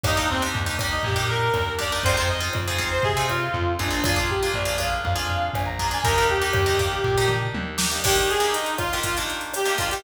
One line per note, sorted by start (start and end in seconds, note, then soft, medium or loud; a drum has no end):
0.04 0.49 D#2 loud
0.04 0.14 A#3 medium
0.04 0.14 D4 medium
0.04 0.14 D#4 medium
0.04 0.14 G4 medium
0.04 kick medium
0.04 cross-stick medium
0.04 floor tom medium
0.15 0.37 A#3 medium
0.15 0.37 D4 medium
0.15 0.27 D#4 medium
0.15 0.37 D#4 medium
0.15 0.37 G4 medium
0.30 0.42 C4 medium
0.30 floor tom medium
0.42 0.62 A#3 medium
0.42 0.62 D4 medium
0.42 0.62 D#4 medium
0.42 0.62 G4 medium
0.54 0.99 D#2 medium
0.54 floor tom loud
0.66 0.76 A#3 medium
0.66 0.76 D4 medium
0.66 0.76 D#4 medium
0.66 0.76 G4 medium
0.79 1.11 A#3 medium
0.79 1.11 D4 medium
0.79 1.11 D#4 medium
0.79 1.11 G4 loud
0.79 kick medium
0.79 cross-stick medium
0.79 floor tom medium
0.91 1.03 D#4 medium
1.03 1.49 A#2 medium
1.03 1.28 G4 medium
1.03 kick medium
1.03 floor tom medium
1.16 1.56 A#3 medium
1.16 1.56 D4 medium
1.16 1.56 D#4 medium
1.16 1.56 G4 medium
1.29 1.74 A#4 medium
1.29 floor tom medium
1.54 1.99 D#2 medium
1.54 cross-stick medium
1.54 floor tom medium
1.79 1.89 A#3 medium
1.79 1.89 D4 medium
1.79 1.89 D#4 medium
1.79 1.89 G4 medium
1.79 2.03 D5 medium
1.79 kick medium
1.79 floor tom medium
1.92 2.02 A#3 medium
1.92 2.02 D4 medium
1.92 2.02 D#4 medium
1.92 2.02 G4 medium
2.03 2.49 F2 loud
2.03 2.16 C4 loud
2.03 2.16 D#4 medium
2.03 2.16 F4 loud
2.03 2.16 G#4 medium
2.03 2.16 C5 medium
2.03 kick medium
2.03 floor tom loud
2.17 2.37 C4 medium
2.17 2.37 D#4 medium
2.17 2.37 F4 medium
2.17 2.37 G#4 medium
2.17 2.29 C5 medium
2.28 2.40 D#5 medium
2.28 floor tom medium
2.41 2.61 C4 medium
2.41 2.61 D#4 medium
2.41 2.61 F4 medium
2.41 2.61 G#4 medium
2.53 2.99 F2 medium
2.53 cross-stick medium
2.53 floor tom loud
2.68 2.78 C4 medium
2.68 2.78 D#4 medium
2.68 2.78 F4 medium
2.68 2.78 G#4 medium
2.78 3.08 C4 medium
2.78 3.08 D#4 medium
2.78 3.08 F4 medium
2.78 3.08 G#4 medium
2.78 kick medium
2.78 floor tom medium
2.91 3.03 C5 medium
3.03 3.49 C3 medium
3.03 3.27 G#4 medium
3.03 kick medium
3.03 floor tom medium
3.17 3.57 C4 medium
3.17 3.57 D#4 medium
3.17 3.57 F4 medium
3.17 3.57 G#4 medium
3.29 3.72 F4 medium
3.29 cross-stick medium
3.29 floor tom medium
3.54 3.78 F2 medium
3.54 floor tom medium
3.79 4.49 A#1 medium
3.79 3.89 C4 medium
3.79 4.05 D4 medium
3.79 3.89 D#4 medium
3.79 3.89 F4 medium
3.79 3.89 G#4 medium
3.79 kick medium
3.79 floor tom medium
3.91 4.01 C4 medium
3.91 4.01 D#4 medium
3.91 4.01 F4 medium
3.91 4.01 G#4 medium
4.04 4.15 A#3 medium
4.04 4.15 D4 loud
4.04 4.29 F4 loud
4.04 4.15 F4 loud
4.04 4.15 G#4 loud
4.04 kick medium
4.04 cross-stick loud
4.04 floor tom loud
4.16 4.36 A#3 medium
4.16 4.36 D4 medium
4.16 4.36 F4 medium
4.16 4.36 G#4 medium
4.29 4.52 G4 medium
4.29 floor tom medium
4.43 4.63 A#3 medium
4.43 4.63 D4 medium
4.43 4.63 F4 medium
4.43 4.63 G#4 medium
4.54 4.99 A#1 loud
4.54 4.75 D5 medium
4.54 floor tom medium
4.65 4.75 A#3 medium
4.65 4.75 D4 medium
4.65 4.75 F4 medium
4.65 4.75 G#4 medium
4.78 5.08 A#3 medium
4.78 5.08 D4 medium
4.78 5.08 F4 medium
4.78 5.08 G#4 medium
4.78 5.02 F5 medium
4.78 kick medium
4.78 cross-stick medium
4.78 floor tom medium
5.04 5.49 F2 medium
5.04 5.48 F5 medium
5.04 kick medium
5.04 floor tom medium
5.16 5.56 A#3 medium
5.16 5.56 D4 medium
5.16 5.56 F4 medium
5.16 5.56 G#4 medium
5.29 floor tom medium
5.54 5.99 A#1 medium
5.54 5.66 G#5 medium
5.54 cross-stick medium
5.54 floor tom medium
5.66 5.88 A#5 medium
5.79 5.89 A#3 medium
5.79 5.89 D4 medium
5.79 5.89 F4 medium
5.79 5.89 G#4 medium
5.79 kick medium
5.79 floor tom medium
5.91 6.01 A#3 medium
5.91 6.01 D4 medium
5.91 6.01 F4 medium
5.91 6.01 G#4 medium
5.91 6.04 G#5 medium
6.04 6.49 D#2 loud
6.04 6.15 A#3 medium
6.04 6.15 D4 loud
6.04 6.15 D#4 medium
6.04 6.15 G4 loud
6.04 6.27 A#4 medium
6.04 kick medium
6.04 floor tom medium
6.18 6.38 A#3 medium
6.18 6.38 D4 medium
6.18 6.38 D#4 medium
6.18 6.38 G4 medium
6.29 7.33 G4 medium
6.29 floor tom medium
6.42 6.62 A#3 medium
6.42 6.62 D4 medium
6.42 6.62 D#4 medium
6.42 6.62 G4 medium
6.53 6.99 D#2 medium
6.53 cross-stick medium
6.53 floor tom loud
6.66 6.76 A#3 medium
6.66 6.76 D4 medium
6.66 6.76 D#4 medium
6.66 6.76 G4 medium
6.79 7.09 A#3 medium
6.79 7.09 D4 medium
6.79 7.09 D#4 medium
6.79 7.09 G4 medium
6.79 kick medium
6.79 floor tom medium
7.04 7.49 A#2 medium
7.04 kick medium
7.04 floor tom medium
7.18 7.58 A#3 medium
7.18 7.58 D4 medium
7.18 7.58 D#4 medium
7.18 7.58 G4 medium
7.28 mid tom medium
7.54 7.99 D#2 medium
7.54 high tom medium
7.78 7.88 A#3 medium
7.78 7.88 D4 medium
7.78 7.88 D#4 medium
7.78 7.88 G4 medium
7.78 snare loud
7.91 8.01 A#3 medium
7.91 8.01 D4 medium
7.91 8.01 D#4 medium
7.91 8.01 G4 medium
8.04 8.35 D#3 loud
8.04 8.35 A#3 medium
8.04 8.35 D4 loud
8.04 8.16 G4 medium
8.04 8.35 G4 medium
8.04 kick medium
8.04 cross-stick medium
8.04 crash loud
8.16 8.30 G4 medium
8.16 closed hi-hat medium
8.29 8.54 G#4 medium
8.29 closed hi-hat medium
8.40 8.80 D#3 medium
8.40 8.80 A#3 medium
8.40 8.80 D4 medium
8.40 8.80 G4 medium
8.40 closed hi-hat medium
8.53 8.75 D#4 medium
8.53 closed hi-hat medium
8.66 closed hi-hat medium
8.77 8.98 F4 medium
8.77 kick medium
8.77 cross-stick medium
8.77 closed hi-hat medium
8.93 9.13 D#3 medium
8.93 9.13 A#3 medium
8.93 9.13 D4 medium
8.93 9.13 G4 medium
8.93 closed hi-hat medium
9.03 9.16 F4 medium
9.03 kick medium
9.03 closed hi-hat medium
9.17 9.58 D#3 medium
9.17 9.58 A#3 medium
9.17 9.58 D4 medium
9.17 9.58 G4 medium
9.17 closed hi-hat medium
9.30 closed hi-hat medium
9.41 closed hi-hat medium
9.54 9.76 G4 medium
9.54 cross-stick medium
9.54 closed hi-hat medium
9.66 9.76 D#3 medium
9.66 9.76 A#3 medium
9.66 9.76 D4 medium
9.66 9.76 G4 medium
9.66 closed hi-hat medium
9.78 9.88 D#3 medium
9.78 9.88 A#3 medium
9.78 9.88 D4 medium
9.78 9.90 F4 medium
9.78 9.88 G4 medium
9.78 kick medium
9.78 closed hi-hat medium
9.90 10.03 D#3 medium
9.90 10.03 A#3 medium
9.90 10.03 D4 medium
9.90 10.02 G4 medium
9.90 10.03 G4 medium
9.90 closed hi-hat medium